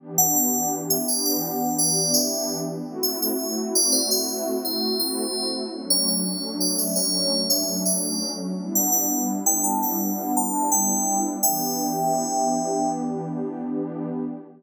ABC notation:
X:1
M:4/4
L:1/16
Q:1/4=84
K:Em
V:1 name="Tubular Bells"
z f f2 z e d f3 d2 e3 z | z e e2 z d c e3 c2 c3 z | z ^c c2 z d e c3 e2 d3 z | z f f2 z g a f3 a2 g3 z |
[eg]10 z6 |]
V:2 name="Pad 2 (warm)"
[E,B,DG]16 | [A,CEF]16 | [F,A,^CD]16 | [G,B,DE]16 |
[E,B,DG]16 |]